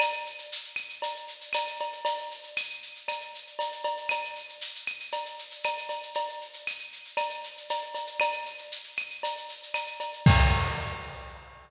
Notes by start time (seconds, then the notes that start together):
0.00 cowbell, claves, shaker
0.13 shaker
0.26 shaker
0.38 shaker
0.52 shaker
0.64 shaker
0.76 claves, shaker
0.89 shaker
1.02 cowbell, shaker
1.16 shaker
1.28 shaker
1.41 shaker
1.53 cowbell, claves, shaker
1.67 shaker
1.80 cowbell, shaker
1.92 shaker
2.05 cowbell, shaker
2.17 shaker
2.31 shaker
2.43 shaker
2.57 claves, shaker
2.70 shaker
2.83 shaker
2.95 shaker
3.08 cowbell, claves, shaker
3.21 shaker
3.34 shaker
3.47 shaker
3.59 cowbell, shaker
3.72 shaker
3.84 cowbell, shaker
3.97 shaker
4.09 cowbell, claves, shaker
4.24 shaker
4.36 shaker
4.49 shaker
4.61 shaker
4.75 shaker
4.87 claves, shaker
5.00 shaker
5.12 cowbell, shaker
5.26 shaker
5.39 shaker
5.51 shaker
5.64 cowbell, claves, shaker
5.78 shaker
5.89 cowbell, shaker
6.02 shaker
6.14 cowbell, shaker
6.29 shaker
6.41 shaker
6.53 shaker
6.67 claves, shaker
6.79 shaker
6.92 shaker
7.05 shaker
7.17 cowbell, claves, shaker
7.30 shaker
7.43 shaker
7.57 shaker
7.70 cowbell, shaker
7.82 shaker
7.95 cowbell, shaker
8.07 shaker
8.20 cowbell, claves, shaker
8.32 shaker
8.46 shaker
8.58 shaker
8.72 shaker
8.84 shaker
8.97 claves, shaker
9.10 shaker
9.23 cowbell, shaker
9.37 shaker
9.49 shaker
9.63 shaker
9.74 cowbell, claves, shaker
9.87 shaker
10.00 cowbell, shaker
10.13 shaker
10.26 kick, crash